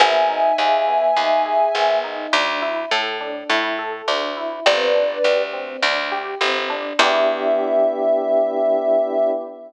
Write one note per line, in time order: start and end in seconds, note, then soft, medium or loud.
0.00 0.52 G#1 medium
0.00 0.26 B3 medium
0.00 2.00 E5 loud
0.00 2.00 G#5 loud
0.29 0.55 D#4 medium
0.58 1.11 D#2 medium
0.58 0.85 G#4 medium
0.87 1.13 B3 medium
1.16 1.69 D#2 medium
1.16 1.42 D#4 medium
1.46 1.72 G#4 medium
1.75 2.27 G#1 medium
1.75 2.01 B3 medium
2.04 2.30 D#4 medium
2.33 2.85 D2 medium
2.33 2.59 D4 medium
2.62 2.88 E4 medium
2.91 3.44 A2 medium
2.91 3.17 A4 medium
3.21 3.47 D4 medium
3.50 4.02 A2 medium
3.50 3.76 E4 medium
3.79 4.05 A4 medium
4.08 4.60 D2 medium
4.08 4.34 D4 medium
4.37 4.63 E4 medium
4.66 5.18 G1 medium
4.66 4.92 C4 medium
4.66 5.44 B4 medium
4.66 5.44 D5 loud
4.95 5.21 D4 medium
5.24 5.77 D2 medium
5.24 5.50 G4 medium
5.53 5.79 C4 medium
5.82 6.35 D2 medium
5.82 6.09 D4 medium
6.12 6.38 G4 medium
6.41 6.93 G1 medium
6.41 6.67 C4 medium
6.70 6.96 D4 medium
6.99 9.31 E2 loud
6.99 9.31 B3 loud
6.99 9.31 D4 loud
6.99 9.31 E4 medium
6.99 9.31 G4 loud
6.99 9.31 E5 loud